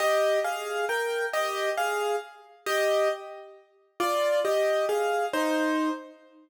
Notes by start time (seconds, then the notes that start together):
0.00 G4 D#5
0.44 G#4 F5
0.89 A#4 G5
1.33 G4 D#5
1.77 G#4 F5
2.66 G4 D#5
4.00 F4 D5
4.45 G4 D#5
4.89 G#4 F5
5.33 D#4 C5